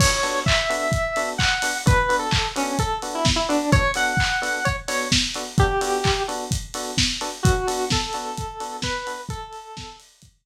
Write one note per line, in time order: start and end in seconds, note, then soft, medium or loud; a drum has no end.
0.00 0.08 B3 loud
0.00 0.08 D4 loud
0.00 0.08 F#4 loud
0.00 0.08 A4 loud
0.00 0.40 C#5 loud
0.00 kick loud
0.00 crash loud
0.23 0.39 B3 medium
0.23 0.39 D4 loud
0.23 0.39 F#4 medium
0.23 0.39 A4 medium
0.23 open hi-hat medium
0.46 1.29 E5 medium
0.46 kick loud
0.46 clap loud
0.70 0.86 B3 loud
0.70 0.86 D4 loud
0.70 0.86 F#4 medium
0.70 0.86 A4 loud
0.70 open hi-hat medium
0.92 kick loud
0.92 closed hi-hat loud
1.16 1.33 B3 medium
1.16 1.33 D4 loud
1.16 1.33 F#4 medium
1.16 1.33 A4 loud
1.16 open hi-hat medium
1.38 1.78 F#5 medium
1.38 kick medium
1.38 clap loud
1.62 1.71 B3 medium
1.62 1.71 D4 loud
1.62 1.71 F#4 medium
1.62 1.71 A4 medium
1.62 open hi-hat loud
1.86 1.94 B3 loud
1.86 1.94 D4 loud
1.86 1.94 F#4 loud
1.86 1.94 A4 loud
1.86 2.16 B4 loud
1.86 kick loud
1.86 closed hi-hat loud
2.09 2.25 B3 medium
2.09 2.25 D4 loud
2.09 2.25 F#4 medium
2.09 2.25 A4 medium
2.09 open hi-hat medium
2.19 2.49 A4 medium
2.31 kick loud
2.31 clap loud
2.56 2.72 B3 loud
2.56 2.78 C#4 medium
2.56 2.72 D4 medium
2.56 2.72 F#4 loud
2.56 2.72 A4 medium
2.56 open hi-hat medium
2.79 2.99 A4 loud
2.79 kick loud
2.79 closed hi-hat loud
3.02 3.19 B3 medium
3.02 3.19 D4 loud
3.02 3.19 F#4 medium
3.02 3.19 A4 medium
3.02 open hi-hat medium
3.15 3.26 E4 medium
3.25 kick loud
3.25 snare loud
3.36 3.47 E4 medium
3.49 3.57 B3 loud
3.49 3.57 D4 loud
3.49 3.71 D4 loud
3.49 3.57 F#4 loud
3.49 3.57 A4 loud
3.49 open hi-hat medium
3.72 3.80 B3 loud
3.72 3.80 D4 loud
3.72 3.80 F#4 loud
3.72 3.80 A4 loud
3.72 3.92 C#5 loud
3.72 kick loud
3.72 closed hi-hat loud
3.94 4.12 B3 medium
3.94 4.12 D4 medium
3.94 4.12 F#4 loud
3.94 4.12 A4 medium
3.94 4.65 F#5 medium
3.94 open hi-hat medium
4.17 kick loud
4.17 clap loud
4.42 4.58 B3 loud
4.42 4.58 D4 medium
4.42 4.58 F#4 medium
4.42 4.58 A4 loud
4.42 open hi-hat medium
4.65 4.76 C#5 loud
4.65 kick medium
4.65 closed hi-hat medium
4.88 5.04 B3 loud
4.88 5.04 D4 medium
4.88 5.04 F#4 loud
4.88 5.04 A4 medium
4.88 5.08 C#5 loud
4.88 open hi-hat loud
5.12 kick medium
5.12 snare loud
5.34 5.43 B3 loud
5.34 5.43 D4 loud
5.34 5.43 F#4 loud
5.34 5.43 A4 medium
5.34 open hi-hat medium
5.58 5.66 B3 loud
5.58 5.66 D4 loud
5.58 5.66 F#4 loud
5.58 6.23 G4 loud
5.58 5.66 A4 loud
5.58 kick loud
5.58 closed hi-hat loud
5.81 5.97 B3 loud
5.81 5.97 D4 medium
5.81 5.97 F#4 loud
5.81 5.97 A4 medium
5.81 open hi-hat medium
6.04 kick loud
6.04 clap loud
6.28 6.44 B3 medium
6.28 6.44 D4 loud
6.28 6.44 F#4 loud
6.28 6.44 A4 medium
6.28 open hi-hat medium
6.51 kick loud
6.51 closed hi-hat loud
6.74 6.91 B3 medium
6.74 6.91 D4 medium
6.74 6.91 F#4 loud
6.74 6.91 A4 loud
6.74 open hi-hat medium
6.98 kick medium
6.98 snare loud
7.21 7.29 B3 medium
7.21 7.29 D4 loud
7.21 7.29 F#4 medium
7.21 7.29 A4 loud
7.21 open hi-hat medium
7.43 7.53 B3 loud
7.43 7.53 D4 loud
7.43 7.85 F#4 loud
7.43 7.53 F#4 loud
7.43 7.53 A4 loud
7.43 kick loud
7.43 closed hi-hat loud
7.67 7.84 B3 loud
7.67 7.84 D4 loud
7.67 7.84 F#4 medium
7.67 7.84 A4 loud
7.67 open hi-hat loud
7.90 8.77 A4 medium
7.90 kick loud
7.90 snare loud
8.13 8.30 B3 loud
8.13 8.30 D4 medium
8.13 8.30 F#4 loud
8.13 8.30 A4 medium
8.13 open hi-hat medium
8.37 kick medium
8.37 closed hi-hat loud
8.60 8.77 B3 loud
8.60 8.77 D4 medium
8.60 8.77 F#4 loud
8.60 8.77 A4 loud
8.60 open hi-hat medium
8.82 9.21 B4 loud
8.82 kick loud
8.82 snare loud
9.07 9.15 B3 medium
9.07 9.15 D4 medium
9.07 9.15 F#4 loud
9.07 9.15 A4 medium
9.07 open hi-hat loud
9.29 9.96 A4 loud
9.29 kick loud
9.29 closed hi-hat loud
9.53 open hi-hat medium
9.77 kick loud
9.77 snare loud
10.00 open hi-hat loud
10.22 kick medium
10.22 closed hi-hat loud